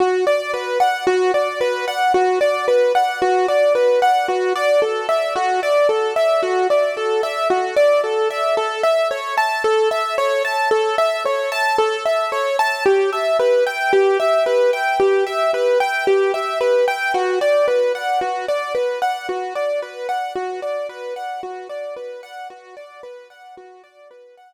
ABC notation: X:1
M:4/4
L:1/16
Q:1/4=56
K:Bm
V:1 name="Acoustic Grand Piano"
F d B f F d B f F d B f F d B f | F d A e F d A e F d A e F d A e | A e c a A e c a A e c a A e c a | G e B g G e B g G e B g G e B g |
F d B f F d B f F d B f F d B f | F d B f F d B f F d B f z4 |]